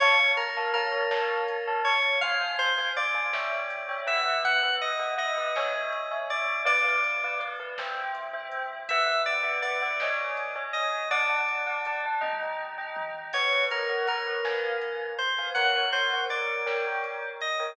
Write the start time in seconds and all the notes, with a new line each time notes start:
0.00 F2 C#5 F5 A5, kick, crash
0.19 C#5 F5 A5
0.37 F2 A#4, closed hi-hat
0.56 C#5 F5 A5
0.74 F2 A#4 C#5 F5 A5, closed hi-hat
0.92 C#5 F5 A5
1.10 A1 C#5 F5 A5, snare
1.48 A1, closed hi-hat
1.67 C#5 F5 A5
1.85 A1 C#5, open hi-hat
2.21 F2 C5 F5 G#5, kick, closed hi-hat
2.41 C5 F5 G#5
2.58 F2 C5, closed hi-hat
2.78 C5 F5 G#5
2.95 C#2 C5 D5 F5 G#5, closed hi-hat
3.14 C5 F5 G#5
3.33 C#5 E5 G5, snare
3.70 C#2, closed hi-hat
3.88 C#5 E5 G5
4.06 C#2 B4 E5 F#5, closed hi-hat
4.43 B1 F#5, kick, closed hi-hat
4.63 B4 E5 F#5
4.81 B1 D#5, closed hi-hat
4.99 B4 E5 F#5
5.18 B1 B4 D#5 E5 F#5, closed hi-hat
5.38 B4 E5 F#5
5.55 C#2 C#5 E5 G#5, snare
5.92 C#2, closed hi-hat
6.11 C#5 E5 G#5
6.30 C#2 D5, closed hi-hat
6.65 B1 B4 D5 F5, kick, closed hi-hat
6.84 B4 D5 F5
7.03 B1, closed hi-hat
7.23 B4 D5 F5
7.40 B1 B4 D5 F5, closed hi-hat
7.59 B4 D5 F5
7.78 C2 C5 E5 G5, snare
8.15 C2, closed hi-hat
8.33 C5 E5 G5
8.52 C2, closed hi-hat
8.89 B1 B4 E5 F#5, kick, closed hi-hat
9.06 B4 E5 F#5
9.26 B1 D5, closed hi-hat
9.43 B4 E5 F#5
9.62 B1 B4 D5 E5 F#5, closed hi-hat
9.82 B4 E5 F#5
10.00 C#2 C#5 D#5 G#5, snare
10.37 C#2, closed hi-hat
10.55 C#5 D#5 G#5
10.73 D2 D#5, closed hi-hat
11.10 D5 F#5 A5, kick, closed hi-hat
11.29 D5 F#5 A5
11.48 D2, closed hi-hat
11.66 D5 F#5 A5
11.85 D2 D5 F#5 A5, closed hi-hat
12.06 D5 F#5 A5
12.21 D#2 D#5 G5 A#5, kick, high tom
12.59 D#2, floor tom
12.78 D#5 G5 A#5
12.96 D#2, mid tom
13.33 B1 B4 C#5 F#5, kick, crash
13.52 B4 C#5 F#5
13.71 B1 A#4 B4 C#5 F#5, closed hi-hat
13.89 B4 C#5 F#5
14.06 B1 A#4 B4 C#5 F#5, closed hi-hat
14.44 F2 B4 F5 G#5, snare
14.81 F2, closed hi-hat
15.19 F2 C5, closed hi-hat
15.38 B4 F5 G#5
15.54 F#2 A#4 C#5 F#5, kick, closed hi-hat
15.75 A#4 C#5 F#5
15.92 F#2 A#4 C5 C#5 F#5, closed hi-hat
16.13 A#4 C#5 F#5
16.30 G1 A#4 C#5 D5 F#5, closed hi-hat
16.66 A#4 C#5 G5, snare
17.04 G1, closed hi-hat
17.41 G1 D#5, closed hi-hat
17.59 A#4 C#5 G5